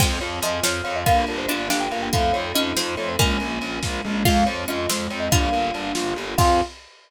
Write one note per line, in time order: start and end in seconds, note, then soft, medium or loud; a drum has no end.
0.00 0.18 F2 loud
0.00 0.19 G#3 loud
0.00 0.19 C4 medium
0.00 1.05 C4 loud
0.00 1.05 F4 loud
0.00 1.05 G#4 loud
0.00 0.16 G5 medium
0.00 kick loud
0.00 crash loud
0.20 0.40 F2 medium
0.20 0.40 F4 medium
0.20 0.39 C#5 medium
0.20 ride medium
0.42 0.60 F2 medium
0.42 0.61 F3 medium
0.42 0.62 G#4 medium
0.42 0.63 D#5 medium
0.42 ride medium
0.63 0.81 F2 medium
0.63 1.02 F3 loud
0.63 0.83 C4 medium
0.63 0.82 C#5 medium
0.63 snare loud
0.84 1.04 F2 medium
0.84 1.03 F4 medium
0.84 0.95 C#5 medium
0.84 ride medium
0.96 1.06 D#5 medium
1.06 1.24 G1 loud
1.06 1.25 A#3 medium
1.06 2.12 A#3 loud
1.06 2.12 D4 loud
1.06 1.26 F4 loud
1.06 2.12 F4 loud
1.06 2.12 G4 loud
1.06 1.26 F5 medium
1.06 kick loud
1.06 ride loud
1.27 1.46 G1 medium
1.27 1.47 D4 medium
1.27 1.39 A#4 medium
1.27 ride medium
1.38 1.48 C5 medium
1.48 1.68 G1 medium
1.48 1.69 D4 loud
1.48 1.68 F4 medium
1.48 1.66 D5 medium
1.48 ride medium
1.70 1.88 G1 medium
1.70 2.10 D4 medium
1.70 1.89 G4 medium
1.70 1.80 F5 medium
1.70 snare loud
1.80 1.91 G5 medium
1.91 2.09 G1 medium
1.91 2.11 A#3 medium
1.91 2.02 F5 medium
1.91 ride medium
2.02 2.13 G5 medium
2.13 2.32 F2 medium
2.13 2.32 A3 loud
2.13 3.18 A3 loud
2.13 3.18 C4 medium
2.13 3.18 D#4 loud
2.13 3.18 F4 loud
2.13 2.31 F4 loud
2.13 2.34 F5 medium
2.13 kick medium
2.13 ride loud
2.33 2.52 F2 medium
2.33 2.52 C4 medium
2.33 2.54 C#5 medium
2.33 ride medium
2.54 2.72 F2 medium
2.54 2.76 C#4 loud
2.54 2.75 D#4 medium
2.54 2.73 D#5 medium
2.54 ride medium
2.76 2.95 F2 medium
2.76 3.15 C4 medium
2.76 2.95 F4 medium
2.76 2.95 C5 medium
2.76 snare loud
2.97 3.16 F2 medium
2.97 3.16 A3 medium
2.97 3.08 C#5 medium
2.97 ride medium
3.09 3.19 C5 medium
3.19 3.38 A#1 medium
3.19 4.24 G#3 loud
3.19 3.38 G#3 loud
3.19 3.38 A#3 loud
3.19 4.24 A#3 loud
3.19 4.24 C#4 loud
3.19 4.24 F4 medium
3.19 3.82 G#5 medium
3.19 kick loud
3.19 ride loud
3.40 3.59 A#1 medium
3.40 3.60 A#3 medium
3.40 ride medium
3.61 3.79 A#1 medium
3.61 3.81 C#4 medium
3.61 ride medium
3.82 4.01 A#1 medium
3.82 4.02 F4 medium
3.82 kick medium
3.82 snare medium
4.05 4.23 A#1 medium
4.05 4.24 G#3 medium
4.25 4.44 F2 medium
4.25 4.45 G#3 loud
4.25 5.31 G#3 loud
4.25 5.31 C4 loud
4.25 4.45 F4 loud
4.25 5.31 F4 loud
4.25 4.46 F5 medium
4.25 kick loud
4.25 crash loud
4.46 4.65 F2 medium
4.46 4.67 C4 medium
4.46 4.63 C#5 medium
4.46 ride medium
4.68 4.86 F2 medium
4.68 4.86 C#4 medium
4.68 4.88 F4 medium
4.68 4.89 D#5 medium
4.68 ride medium
4.89 5.07 F2 medium
4.89 5.09 G#3 medium
4.89 5.30 C4 medium
4.89 5.09 C5 medium
4.89 snare loud
5.10 5.28 F2 medium
5.10 5.30 C4 medium
5.10 5.21 C#5 medium
5.10 ride medium
5.20 5.30 D#5 medium
5.31 5.49 G1 loud
5.31 6.37 G3 loud
5.31 5.52 G3 medium
5.31 6.37 A#3 medium
5.31 6.37 D4 loud
5.31 5.92 D4 medium
5.31 6.37 F4 loud
5.31 5.92 F4 loud
5.31 5.91 F5 medium
5.31 kick loud
5.31 ride loud
5.52 5.71 G1 medium
5.52 5.71 A#3 medium
5.52 ride medium
5.74 5.92 G1 medium
5.74 5.94 D4 medium
5.74 ride medium
5.95 6.13 G1 medium
5.95 6.14 F4 medium
5.95 snare loud
6.16 6.34 G1 medium
6.16 6.36 G3 medium
6.16 ride medium
6.38 6.61 F2 loud
6.38 6.61 C4 medium
6.38 6.61 F4 loud
6.38 6.61 G#4 medium
6.38 6.61 G#4 loud
6.38 6.60 F5 loud
6.38 kick loud
6.38 crash loud